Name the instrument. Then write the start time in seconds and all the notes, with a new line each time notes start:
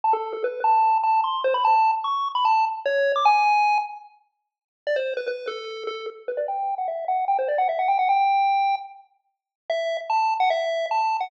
lead 1 (square)
0.04 A5
0.13 A4
0.33 A4
0.44 B4
0.64 A5
1.04 A5
1.24 C6
1.44 C5
1.54 B5
1.65 A5
2.04 C#6
2.35 B5
2.45 A5
2.86 C#5
3.16 D6
3.25 G#5
4.87 D5
4.96 C5
5.17 B4
5.28 B4
5.47 A4
5.87 A4
6.28 B4
6.37 D5
6.48 G5
6.78 F#5
6.88 E5
7.08 F#5
7.28 G5
7.39 C5
7.48 D5
7.58 F#5
7.69 E5
7.79 F#5
7.88 G5
7.99 F#5
8.09 G5
9.70 E5
10.10 A5
10.40 F#5
10.50 E5
10.91 A5
11.21 F#5